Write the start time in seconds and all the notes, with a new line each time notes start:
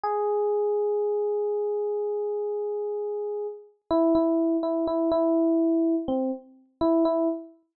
0.03 G#4
3.91 E4
4.15 E4
4.63 E4
4.87 E4
5.11 E4
6.08 C4
6.81 E4
7.05 E4